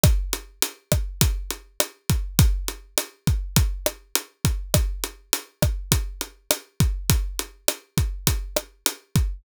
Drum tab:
HH |xxxxxxxx|xxxxxxxx|xxxxxxxx|xxxxxxxx|
SD |r--r--r-|--r--r--|r--r--r-|--r--r--|
BD |o--oo--o|o--oo--o|o--oo--o|o--oo--o|